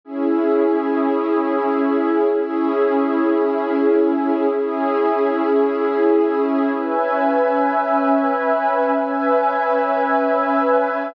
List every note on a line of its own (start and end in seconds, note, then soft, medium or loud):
0.04 2.24 C#4 medium
0.04 2.24 E4 loud
0.04 2.24 G#4 medium
2.25 4.45 C#4 loud
2.25 4.45 E4 loud
2.25 4.45 G#4 loud
4.49 6.69 C#4 medium
4.49 6.69 E4 loud
4.49 6.69 G#4 loud
6.71 8.91 C#4 medium
6.71 8.91 B4 loud
6.71 8.91 E5 medium
6.71 8.91 G#5 medium
8.94 11.14 C#4 medium
8.94 11.14 B4 loud
8.94 11.14 E5 loud
8.94 11.14 G#5 medium